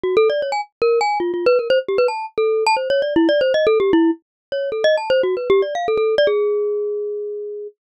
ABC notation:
X:1
M:4/4
L:1/16
Q:1/4=154
K:none
V:1 name="Glockenspiel"
(3_G2 A2 d2 _d _a z2 _B2 a2 (3F2 F2 =B2 | _B c z G =B a2 z A3 a (3c2 _d2 =d2 | (3E2 d2 c2 (3_e2 A2 G2 =E2 z4 _d2 | (3A2 _e2 a2 (3c2 _G2 B2 (3=G2 d2 f2 A A2 d |
_A16 |]